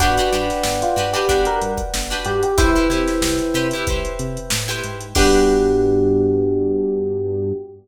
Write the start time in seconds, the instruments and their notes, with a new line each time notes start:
0.00 synth bass 1 G1, acoustic guitar (steel) D4 F#4 G4 B4, electric piano 1 F#4 B4 D5 F#5 G5, kick, closed hi-hat
0.17 acoustic guitar (steel) D4 F#4 G4 B4, closed hi-hat
0.33 synth bass 1 G2, acoustic guitar (steel) D4 F#4 G4 B4, closed hi-hat
0.50 snare, closed hi-hat
0.63 synth bass 1 G1, snare
0.82 electric piano 1 F4, closed hi-hat
0.96 synth bass 1 G2, acoustic guitar (steel) D4 F#4 G4 B4, closed hi-hat
1.13 acoustic guitar (steel) D4 F#4 G4 B4, electric piano 1 G4, closed hi-hat
1.28 synth bass 1 G1, acoustic guitar (steel) D4 F#4 G4 B4, kick, closed hi-hat
1.45 electric piano 1 A#4, closed hi-hat
1.62 synth bass 1 G2, closed hi-hat
1.77 kick, closed hi-hat
1.94 synth bass 1 G1, snare
2.10 acoustic guitar (steel) D4 F#4 G4 B4, closed hi-hat
2.25 synth bass 1 G2, electric piano 1 G4, closed hi-hat
2.43 electric piano 1 G4, closed hi-hat
2.58 synth bass 1 C2, acoustic guitar (steel) E4 G4 B4 C5, electric piano 1 E4 B4 C5 E5 G5, kick, closed hi-hat
2.76 acoustic guitar (steel) E4 G4 B4 C5, closed hi-hat
2.90 synth bass 1 C3, acoustic guitar (steel) E4 G4 B4 C5, snare, closed hi-hat
3.08 snare, closed hi-hat
3.22 synth bass 1 C2, snare
3.39 closed hi-hat
3.54 synth bass 1 C3, acoustic guitar (steel) E4 G4 B4 C5, closed hi-hat
3.71 acoustic guitar (steel) E4 G4, closed hi-hat
3.75 acoustic guitar (steel) B4 C5
3.87 synth bass 1 C2, acoustic guitar (steel) E4 G4 B4 C5, kick, closed hi-hat
4.05 closed hi-hat
4.19 synth bass 1 C3, closed hi-hat
4.37 closed hi-hat
4.50 synth bass 1 A2, snare
4.68 acoustic guitar (steel) E4 G4 B4 C5, closed hi-hat
4.84 synth bass 1 G#2, closed hi-hat
5.01 closed hi-hat
5.15 synth bass 1 G2, electric piano 1 B3 D4 F#4 G4, acoustic guitar (steel) D4 F#4 G4 B4, kick, crash